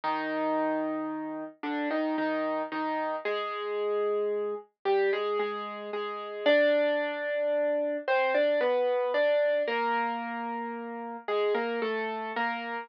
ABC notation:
X:1
M:3/4
L:1/16
Q:1/4=56
K:Cm
V:1 name="Acoustic Grand Piano"
[E,E]6 [D,D] [E,E] [E,E]2 [E,E]2 | [A,A]6 [G,G] [A,A] [A,A]2 [A,A]2 | [Dd]6 [Cc] [Dd] [=B,=B]2 [Dd]2 | [B,B]6 [A,A] [B,B] [=A,=A]2 [B,B]2 |]